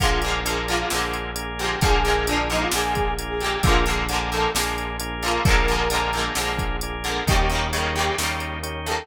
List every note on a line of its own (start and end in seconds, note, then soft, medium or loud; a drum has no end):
0.00 0.83 A#1 medium
0.00 0.21 D3 medium
0.00 0.21 F3 medium
0.00 0.21 G#3 medium
0.00 0.41 A#3 loud
0.00 0.41 D4 loud
0.00 0.41 F4 loud
0.00 0.20 F4 loud
0.00 0.41 G#4 loud
0.00 kick medium
0.00 closed hi-hat medium
0.05 0.21 A#3 medium
0.22 0.44 D3 medium
0.22 0.44 F3 medium
0.22 closed hi-hat medium
0.26 0.44 G#3 medium
0.26 0.44 A#3 medium
0.45 0.66 D3 medium
0.45 0.66 F3 medium
0.45 0.86 A#3 loud
0.45 0.86 D4 medium
0.45 0.86 F4 medium
0.45 0.86 G#4 medium
0.45 closed hi-hat loud
0.49 0.66 G#3 medium
0.49 0.66 A#3 medium
0.68 0.89 D3 medium
0.68 0.89 F3 medium
0.68 0.89 G#3 medium
0.68 0.89 F4 loud
0.68 closed hi-hat medium
0.73 0.89 A#3 medium
0.90 1.75 A#1 medium
0.90 1.54 D3 medium
0.90 1.54 F3 medium
0.90 1.54 G#3 medium
0.90 1.31 A#3 medium
0.90 1.31 D4 medium
0.90 1.31 F4 medium
0.90 1.31 G#4 medium
0.90 snare medium
0.96 1.54 A#3 medium
1.13 closed hi-hat medium
1.35 1.76 A#3 medium
1.35 1.76 D4 medium
1.35 1.76 F4 medium
1.35 1.76 G#4 medium
1.35 closed hi-hat loud
1.59 1.80 D3 medium
1.59 1.80 F3 medium
1.59 1.80 G#3 medium
1.59 1.78 G4 medium
1.59 closed hi-hat medium
1.64 1.80 A#3 medium
1.81 2.65 A#1 loud
1.81 2.03 D3 medium
1.81 2.03 F3 medium
1.81 2.03 G#3 medium
1.81 2.24 A#3 loud
1.81 2.24 D4 loud
1.81 2.24 F4 loud
1.81 2.26 G#4 loud
1.81 2.24 G#4 loud
1.81 kick loud
1.81 closed hi-hat medium
1.87 2.03 A#3 medium
2.05 2.25 D3 medium
2.05 2.25 F3 medium
2.05 2.25 G#3 medium
2.05 closed hi-hat medium
2.10 2.25 A#3 medium
2.27 2.48 D3 medium
2.27 2.48 F3 medium
2.27 2.48 G#3 medium
2.27 2.68 A#3 medium
2.27 2.68 D4 medium
2.27 2.46 D4 loud
2.27 2.68 F4 loud
2.27 2.68 G#4 medium
2.27 closed hi-hat loud
2.32 2.48 A#3 medium
2.50 2.71 D3 medium
2.50 2.71 F3 medium
2.50 2.71 G#3 medium
2.50 2.61 D#4 loud
2.50 closed hi-hat medium
2.55 2.71 A#3 medium
2.61 2.72 F4 medium
2.71 3.57 A#1 medium
2.71 3.35 D3 medium
2.71 3.35 F3 medium
2.71 3.14 A#3 medium
2.71 3.14 D4 loud
2.71 3.14 F4 medium
2.71 3.14 G#4 medium
2.71 3.11 G#4 medium
2.71 snare loud
2.76 3.35 G#3 medium
2.76 3.35 A#3 medium
2.95 kick medium
2.95 closed hi-hat medium
3.19 3.60 A#3 medium
3.19 3.60 D4 medium
3.19 3.60 F4 medium
3.19 3.60 G#4 medium
3.19 closed hi-hat medium
3.29 3.40 G#4 medium
3.40 3.62 D3 medium
3.40 3.62 F3 medium
3.40 3.62 G#3 medium
3.40 3.62 G4 medium
3.40 closed hi-hat medium
3.46 3.62 A#3 medium
3.63 4.47 A#1 medium
3.63 3.85 D3 medium
3.63 3.85 F3 medium
3.63 3.85 G#3 medium
3.63 4.04 A#3 loud
3.63 4.04 D4 loud
3.63 4.04 F4 loud
3.63 3.83 F4 loud
3.63 4.04 G#4 loud
3.63 kick loud
3.63 closed hi-hat medium
3.69 3.85 A#3 medium
3.86 4.07 D3 medium
3.86 4.07 F3 medium
3.86 closed hi-hat medium
3.90 4.07 G#3 medium
3.90 4.07 A#3 medium
4.09 4.30 D3 medium
4.09 4.30 F3 medium
4.09 4.30 G#3 medium
4.09 4.50 A#3 loud
4.09 4.50 D4 medium
4.09 4.50 F4 medium
4.09 4.50 G#4 medium
4.09 closed hi-hat medium
4.14 4.30 A#3 medium
4.32 4.53 D3 medium
4.32 4.53 F3 medium
4.32 4.53 G#3 medium
4.32 4.51 A4 medium
4.32 closed hi-hat medium
4.37 4.53 A#3 medium
4.55 5.38 A#1 medium
4.55 5.17 D3 medium
4.55 5.17 F3 medium
4.55 5.17 G#3 medium
4.55 4.97 A#3 loud
4.55 4.97 D4 medium
4.55 4.97 F4 medium
4.55 4.97 G#4 medium
4.55 snare loud
4.60 5.17 A#3 medium
4.78 closed hi-hat medium
5.00 5.41 A#3 loud
5.00 5.41 D4 medium
5.00 5.41 F4 loud
5.00 5.41 G#4 medium
5.00 closed hi-hat loud
5.22 5.44 D3 medium
5.22 5.44 F3 medium
5.22 5.44 G#3 medium
5.22 5.43 F4 medium
5.22 closed hi-hat medium
5.28 5.44 A#3 medium
5.45 6.29 A#1 medium
5.45 5.66 D3 loud
5.45 5.66 F3 medium
5.45 5.66 G#3 medium
5.45 5.88 A#3 loud
5.45 5.88 D4 loud
5.45 5.88 F4 loud
5.45 5.88 G#4 loud
5.45 6.19 A#4 loud
5.45 kick loud
5.45 closed hi-hat medium
5.50 5.66 A#3 medium
5.68 5.89 D3 medium
5.68 5.89 F3 medium
5.68 5.89 G#3 medium
5.68 closed hi-hat medium
5.73 5.89 A#3 medium
5.90 6.12 D3 medium
5.90 6.12 F3 medium
5.90 6.33 A#3 medium
5.90 6.33 D4 medium
5.90 6.33 F4 loud
5.90 6.33 G#4 loud
5.90 closed hi-hat loud
5.94 6.12 G#3 medium
5.94 6.12 A#3 medium
6.13 6.35 D3 medium
6.13 6.35 F3 medium
6.13 closed hi-hat medium
6.17 6.35 G#3 medium
6.17 6.35 A#3 medium
6.35 7.20 A#1 medium
6.35 6.99 D3 medium
6.35 6.99 F3 medium
6.35 6.77 A#3 medium
6.35 6.77 D4 medium
6.35 6.77 F4 medium
6.35 6.77 G#4 medium
6.35 snare medium
6.40 6.99 G#3 medium
6.40 6.99 A#3 medium
6.59 kick medium
6.59 closed hi-hat medium
6.81 7.23 A#3 medium
6.81 7.23 D4 medium
6.81 7.23 F4 medium
6.81 7.23 G#4 medium
6.81 closed hi-hat medium
7.04 7.25 D3 medium
7.04 7.25 F3 medium
7.04 closed hi-hat medium
7.08 7.25 G#3 medium
7.08 7.25 A#3 medium
7.27 8.10 D#2 loud
7.27 7.48 C#3 medium
7.27 7.48 D#3 medium
7.27 7.48 G3 medium
7.27 7.68 A#3 loud
7.27 7.68 C#4 loud
7.27 7.68 D#4 loud
7.27 7.68 G4 loud
7.27 7.46 G4 loud
7.27 kick loud
7.27 closed hi-hat medium
7.32 7.48 A#3 medium
7.50 7.71 C#3 medium
7.50 7.71 D#3 medium
7.50 7.71 G3 medium
7.50 closed hi-hat medium
7.55 7.71 A#3 medium
7.73 7.94 C#3 medium
7.73 7.94 D#3 medium
7.73 7.94 G3 medium
7.73 8.15 A#3 loud
7.73 8.15 C#4 loud
7.73 8.15 D#4 medium
7.73 8.15 G4 medium
7.73 closed hi-hat medium
7.78 7.94 A#3 medium
7.95 8.16 C#3 medium
7.95 8.16 D#3 medium
7.95 8.16 G3 medium
7.95 8.14 G4 loud
7.95 closed hi-hat medium
8.00 8.16 A#3 medium
8.18 9.02 D#2 medium
8.18 8.81 C#3 medium
8.18 8.81 D#3 medium
8.18 8.81 G3 medium
8.18 8.59 A#3 medium
8.18 8.59 C#4 medium
8.18 8.59 D#4 medium
8.18 8.59 G4 medium
8.18 snare medium
8.23 8.81 A#3 medium
8.40 closed hi-hat medium
8.63 9.04 A#3 medium
8.63 9.04 C#4 medium
8.63 9.04 D#4 medium
8.63 9.04 G4 medium
8.63 closed hi-hat medium
8.86 9.07 C#3 medium
8.86 9.07 D#3 medium
8.86 9.06 A4 medium
8.86 closed hi-hat medium
8.90 9.07 G3 medium
8.90 9.07 A#3 medium